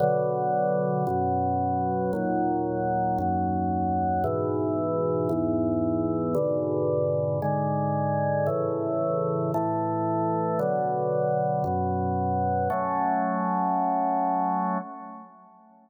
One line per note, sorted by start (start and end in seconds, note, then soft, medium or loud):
0.00 1.05 B2 loud
0.00 1.05 D3 loud
0.00 1.05 F#3 loud
1.07 2.12 F#2 loud
1.07 2.12 B2 medium
1.07 2.12 F#3 medium
2.13 3.18 D#2 medium
2.13 3.18 A#2 loud
2.13 3.18 F#3 medium
3.18 4.23 D#2 medium
3.18 4.23 F#2 medium
3.18 4.23 F#3 loud
4.24 5.29 G#2 loud
4.24 5.29 B2 loud
4.24 5.29 E3 medium
5.29 6.34 E2 loud
5.29 6.34 G#2 medium
5.29 6.34 E3 medium
6.35 7.39 G#2 medium
6.35 7.39 B2 loud
6.35 7.39 D3 medium
7.42 8.47 G#2 medium
7.42 8.47 D3 loud
7.42 8.47 G#3 medium
8.46 9.51 A2 medium
8.46 9.51 C#3 medium
8.46 9.51 E3 loud
9.54 10.59 A2 loud
9.54 10.59 E3 loud
9.54 10.59 A3 medium
10.59 11.63 B2 medium
10.59 11.64 D3 medium
10.59 11.63 F#3 medium
11.64 12.69 F#2 medium
11.64 12.69 B2 medium
11.64 12.69 F#3 medium
12.70 14.78 F#3 loud
12.70 14.78 A3 loud
12.70 14.78 C#4 medium